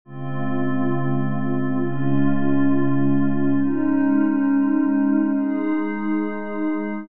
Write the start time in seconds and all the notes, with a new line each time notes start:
0.05 C#3 G#3 C4 F4
1.78 C#3 G#3 C#4 F4
3.56 G#3 C#4 D#4
5.33 G#3 D#4 G#4